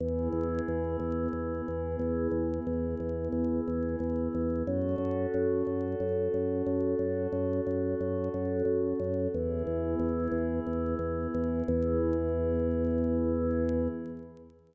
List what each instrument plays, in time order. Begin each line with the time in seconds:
0.00 drawbar organ E2, pad 5 (bowed) B3 E4 G#4
0.33 drawbar organ E2
0.68 drawbar organ E2
1.00 drawbar organ E2
1.33 drawbar organ E2
1.68 drawbar organ E2
1.99 drawbar organ E2
2.32 drawbar organ E2
2.67 drawbar organ E2
3.00 drawbar organ E2
3.32 drawbar organ E2
3.68 drawbar organ E2
4.00 drawbar organ E2
4.35 drawbar organ E2
4.67 drawbar organ F#2, pad 5 (bowed) C#4 F#4 A4
4.98 drawbar organ F#2
5.34 drawbar organ F#2
5.67 drawbar organ F#2
6.00 drawbar organ F#2
6.34 drawbar organ F#2
6.67 drawbar organ F#2
6.99 drawbar organ F#2
7.33 drawbar organ F#2
7.67 drawbar organ F#2
8.01 drawbar organ F#2
8.34 drawbar organ F#2
8.65 drawbar organ F#2
9.00 drawbar organ F#2
9.33 drawbar organ E2, pad 5 (bowed) B3 E4 G#4
9.67 drawbar organ E2
9.99 drawbar organ E2
10.32 drawbar organ E2
10.67 drawbar organ E2
10.99 drawbar organ E2
11.34 drawbar organ E2
11.66 drawbar organ E2, pad 5 (bowed) B3 E4 G#4